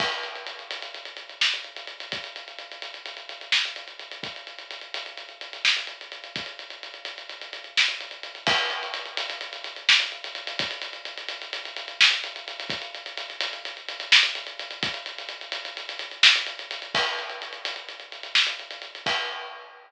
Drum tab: CC |x-----------------|------------------|------------------|------------------|
HH |-xxxxxxxxxxx-xxxxx|xxxxxxxxxxxx-xxxxx|xxxxxxxxxxxx-xxxxx|xxxxxxxxxxxx-xxxxx|
SD |------------o-----|------------o-----|------------o-----|------------o-----|
BD |o-----------------|o-----------------|o-----------------|o-----------------|

CC |x-----------------|------------------|------------------|------------------|
HH |-xxxxxxxxxxx-xxxxx|xxxxxxxxxxxx-xxxxx|xxxxxxxxxxxx-xxxxx|xxxxxxxxxxxx-xxxxx|
SD |------------o-----|------------o-----|------------o-----|------------o-----|
BD |o-----------------|o-----------------|o-----------------|o-----------------|

CC |x-----------------|x-----------------|
HH |-xxxxxxxxxxx-xxxxx|------------------|
SD |------------o-----|------------------|
BD |o-----------------|o-----------------|